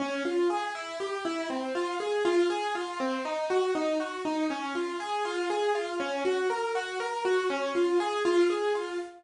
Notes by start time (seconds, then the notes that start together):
0.00 C#4
0.25 F4
0.50 G#4
0.75 E4
1.00 G4
1.25 E4
1.50 C4
1.75 F4
2.00 G#4
2.25 F4
2.50 G#4
2.75 F4
3.00 C4
3.25 D#4
3.50 F#4
3.75 D#4
4.00 F#4
4.25 D#4
4.50 C#4
4.75 F4
5.00 G#4
5.25 F4
5.50 G#4
5.75 F4
6.00 C#4
6.25 F#4
6.50 A#4
6.75 F#4
7.00 A#4
7.25 F#4
7.50 C#4
7.75 F4
8.00 G#4
8.25 F4
8.50 G#4
8.75 F4